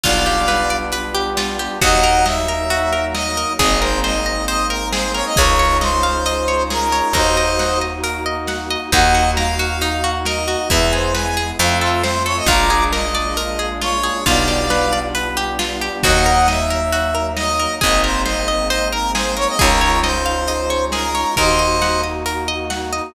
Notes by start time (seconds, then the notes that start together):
0.04 B1 G3 B3 D4 F4 D5 F5, kick, closed hi-hat
0.26 G4
0.48 B4, snare
0.70 D5
0.92 B4, closed hi-hat
1.15 G4
1.37 F4, snare
1.59 G4
1.81 D#2 F#3 A#3 D#4 F#4 D#5 F#5, kick, closed hi-hat
2.03 A#4
2.26 D#5 E5, snare
2.48 A#4
2.70 F#4, closed hi-hat
2.92 A#4
3.15 D#5, snare
3.37 A#4
3.59 G#1 G#3 A#3 C4 D#4 G#4 D#5, kick, closed hi-hat
3.82 A#4 C5
4.04 C5 D#5, snare
4.26 D#5
4.48 C5 D#5, closed hi-hat
4.70 A#4
4.92 G#4 C5, snare
5.14 A#4 C#5
5.26 D#5
5.36 C#2 G#3 C#4 D#4 F4 G#4 A#4 C#5, kick, closed hi-hat
5.59 C#5
5.81 C5 D#5, snare
6.03 F5
6.26 D#5, closed hi-hat
6.48 C#5
6.70 G#4 A#4, snare
6.92 C#5
7.13 D#2 A#3 D#4 F#4 A#4 C5 D#5, kick, closed hi-hat
7.37 D#5
7.59 F#5, snare
7.81 D#5
8.04 A#4, closed hi-hat
8.26 D#5
8.47 F#5, snare
8.70 D#5
8.92 D#2 A#3 D#4 F#4 D#5 F#5, kick, closed hi-hat
9.14 F#4
9.37 A#4 F5, snare
9.59 F#4
9.81 D#4, closed hi-hat
10.04 F#4
10.25 A#4 D#5, snare
10.48 F#4
10.70 E2 G#3 B3 E4 E5, kick, closed hi-hat
10.92 G#4 C5
11.14 B4 G#5, snare
11.37 G#4
11.59 F2 A3 C4 F4 F5, closed hi-hat
11.81 F4 A4
12.04 C5, snare
12.26 A4 C#5
12.37 D#5
12.46 A#1 G#3 A#3 D4 F4 A#5 D6, kick, closed hi-hat
12.70 G#4
12.92 A#4 D#5, snare
13.15 D5
13.37 A#4, closed hi-hat
13.59 G#4
13.81 F4 C#5, snare
14.03 G#4
14.26 B1 G3 B3 D4 F4 D5 F5, kick, closed hi-hat
14.48 G4
14.70 B4, snare
14.93 D5
15.15 B4, closed hi-hat
15.37 G4
15.59 F4, snare
15.81 G4
16.03 D#2 F#3 A#3 D#4 F#4 D#5 F#5, kick, closed hi-hat
16.26 A#4
16.48 D#5 E5, snare
16.70 A#4
16.92 F#4, closed hi-hat
17.15 A#4
17.37 D#5, snare
17.59 A#4
17.81 G#1 G#3 A#3 C4 D#4 G#4 D#5, kick, closed hi-hat
18.04 A#4 C5
18.26 C5 D#5, snare
18.48 D#5
18.70 C5 D#5, closed hi-hat
18.92 A#4
19.15 G#4 C5, snare
19.37 A#4 C#5
19.48 D#5
19.59 C#2 G#3 C#4 D#4 F4 G#4 A#4 C#5, kick, closed hi-hat
19.81 C#5
20.03 C5 D#5, snare
20.26 F5
20.48 D#5, closed hi-hat
20.70 C#5
20.92 G#4 A#4, snare
21.15 C#5
21.37 D#2 A#3 D#4 F#4 A#4 C5 D#5, kick, closed hi-hat
21.59 D#5
21.82 F#5, snare
22.04 D#5
22.26 A#4, closed hi-hat
22.48 D#5
22.70 F#5, snare
22.93 D#5